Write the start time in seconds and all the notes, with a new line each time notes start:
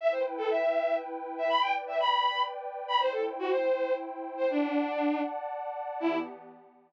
0.01 E4 B4 E5 G5
0.11 C5
0.38 A4
0.50 E5
1.38 E5
1.49 B4 D5 G5 B5
1.61 G5
1.87 E5
2.00 B5
2.88 B5
2.99 E4 C5 G5
3.12 A4
3.39 F#4
3.50 C5
4.37 C5
4.50 D4 D5 F#5 A5
6.00 E3 B3 E4 G4